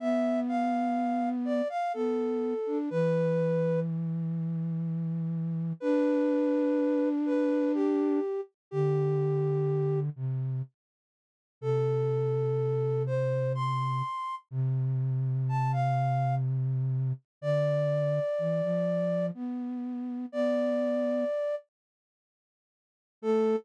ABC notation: X:1
M:3/4
L:1/16
Q:1/4=62
K:Am
V:1 name="Flute"
e2 f4 d f A4 | B4 z8 | B6 B2 G3 z | G6 z6 |
A6 c2 c'4 | z4 a f3 z4 | d8 z4 | d6 z6 |
A4 z8 |]
V:2 name="Flute"
B,8 B,3 D | E,12 | D12 | D,6 C,2 z4 |
C,12 | C,12 | D,4 E, F,3 B,4 | B,4 z8 |
A,4 z8 |]